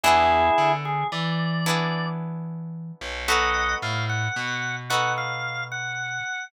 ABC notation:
X:1
M:12/8
L:1/8
Q:3/8=74
K:B
V:1 name="Drawbar Organ"
[EG]3 G =d4 z4 | [df]2 ^e f3 f e2 f3 |]
V:2 name="Acoustic Guitar (steel)"
[B,=DEG]6 [B,DEG]6 | [B,DF=A]6 [B,DFA]6 |]
V:3 name="Electric Bass (finger)" clef=bass
E,,2 =D,2 E,7 B,,,- | B,,,2 =A,,2 B,,8 |]